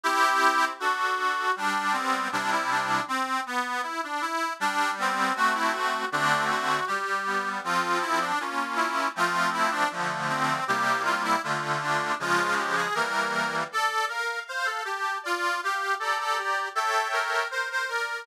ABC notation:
X:1
M:2/4
L:1/16
Q:1/4=79
K:G
V:1 name="Accordion"
[EG]4 F4 | D2 C2 D E D2 | C2 B,2 E D E2 | D2 C2 F E F2 |
D2 F2 G4 | [K:F] F2 E D z2 E2 | F2 E D z2 C2 | G2 F E z2 D2 |
F2 G _A B4 | [K:Dm] A2 B2 c A G2 | F2 G2 A A G2 | A2 B2 c c B2 |]
V:2 name="Accordion"
[CE]4 [DA]4 | G,2 B,2 [C,G,E]4 | z8 | G,2 B,2 [A,CF]4 |
[D,A,CF]4 G,2 B,2 | [K:F] [F,CA]4 [B,_DF]4 | [F,A,C]4 [D,F,A,]4 | [C,G,B,E]4 [D,A,F]4 |
[_D,F,_A,]4 [E,G,B,]4 | [K:Dm] d2 f2 f2 a2 | d2 f2 [Gdb]4 | [A^ceg]4 B2 d2 |]